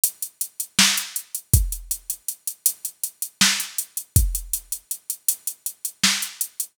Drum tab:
HH |xxxx-xxx|xxxxxxxxxx-xxx|xxxxxxxxxx-xxx|
SD |----o---|----------o---|----------o---|
BD |--------|o-------------|o-------------|